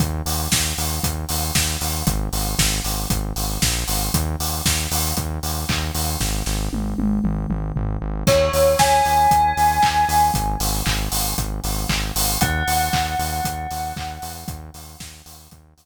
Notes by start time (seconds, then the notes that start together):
0.00 D#2, kick, closed hi-hat
0.26 D#2, open hi-hat
0.52 D#2, kick, snare
0.77 D#2, open hi-hat
1.03 D#2, kick, closed hi-hat
1.29 D#2, open hi-hat
1.55 D#2, kick, snare
1.81 D#2, open hi-hat
2.07 G#1, kick, closed hi-hat
2.33 G#1, open hi-hat
2.59 G#1, kick, snare
2.84 G#1, open hi-hat
3.10 G#1, kick, closed hi-hat
3.36 G#1, open hi-hat
3.62 A#1, kick, snare
3.88 G#1, open hi-hat
4.14 D#2, kick, closed hi-hat
4.40 D#2, open hi-hat
4.65 D#2, kick, snare
4.91 D#2, open hi-hat
5.17 D#2, kick, closed hi-hat
5.43 D#2, open hi-hat
5.69 D#2, kick, clap
5.95 D#2, open hi-hat
6.20 G#1, kick, snare
6.46 G#1, snare
6.73 G#1, high tom
6.98 G#1, high tom
7.24 G#1, mid tom
7.50 G#1, mid tom
7.76 G#1, floor tom
8.02 G#1
8.27 D#2 C#5, kick, crash
8.53 D#2, open hi-hat
8.79 D#2 G#5, kick, snare
9.05 D#2, open hi-hat
9.31 D#2, kick, closed hi-hat
9.57 D#2, open hi-hat
9.83 D#2, kick, clap
10.09 D#2, open hi-hat
10.34 G#1, kick, closed hi-hat
10.60 G#1, open hi-hat
10.86 G#1, kick, clap
11.12 G#1, open hi-hat
11.38 G#1, kick, closed hi-hat
11.64 G#1, open hi-hat
11.89 G#1, kick, clap
12.15 G#1, open hi-hat
12.41 D#2 F#5, kick, closed hi-hat
12.67 D#2, open hi-hat
12.93 D#2, kick, clap
13.19 D#2, open hi-hat
13.45 D#2, kick, closed hi-hat
13.71 D#2, open hi-hat
13.96 D#2, kick, clap
14.22 E2, open hi-hat
14.48 D#2, kick, closed hi-hat
14.74 D#2, open hi-hat
15.00 D#2, kick, snare
15.26 D#2, open hi-hat
15.51 D#2, kick, closed hi-hat
15.77 D#2, open hi-hat